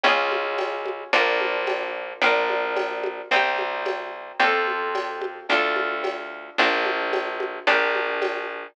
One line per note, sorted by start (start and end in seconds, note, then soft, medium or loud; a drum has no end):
0.04 1.04 C#2 loud
0.04 1.11 C#4 medium
0.04 1.11 F4 medium
0.04 cowbell medium
0.04 low conga medium
0.09 1.11 G#4 medium
0.31 high conga medium
0.58 tambourine medium
0.58 cowbell medium
0.58 high conga medium
0.86 high conga medium
1.13 2.13 A#1 loud
1.13 2.20 D4 medium
1.13 2.20 F4 medium
1.13 cowbell medium
1.13 low conga medium
1.18 2.20 A#4 medium
1.41 high conga medium
1.67 tambourine medium
1.67 cowbell medium
1.67 high conga medium
2.22 3.22 A#1 loud
2.22 3.29 D4 medium
2.22 3.29 F4 medium
2.22 cowbell medium
2.22 low conga medium
2.26 3.29 A#4 medium
2.49 high conga medium
2.76 tambourine medium
2.76 cowbell medium
2.76 high conga medium
3.04 high conga medium
3.31 4.32 C2 loud
3.31 4.38 C4 medium
3.31 4.38 D#4 medium
3.31 cowbell medium
3.31 low conga medium
3.36 4.38 G4 medium
3.58 high conga medium
3.86 tambourine medium
3.86 cowbell medium
3.86 high conga medium
4.40 5.40 F2 loud
4.40 5.46 C4 medium
4.40 5.46 F4 medium
4.40 cowbell medium
4.40 low conga medium
4.44 5.46 A4 medium
4.67 high conga medium
4.95 tambourine medium
4.95 cowbell medium
4.95 high conga medium
5.21 high conga medium
5.49 6.50 D2 loud
5.49 6.56 D4 medium
5.49 6.56 F4 medium
5.49 cowbell medium
5.49 low conga medium
5.54 6.56 A4 medium
5.76 high conga medium
6.04 tambourine medium
6.04 cowbell medium
6.04 high conga medium
6.58 7.59 A#1 loud
6.58 7.65 D4 medium
6.58 7.65 F4 medium
6.58 cowbell medium
6.58 low conga medium
6.63 7.65 A#4 medium
6.85 high conga medium
7.13 tambourine medium
7.13 cowbell medium
7.13 high conga medium
7.40 high conga medium
7.67 8.67 A#1 loud
7.67 8.74 D4 medium
7.67 8.74 G4 medium
7.67 cowbell medium
7.67 low conga medium
7.72 8.74 A#4 medium
7.95 high conga medium
8.22 tambourine medium
8.22 cowbell medium
8.22 high conga medium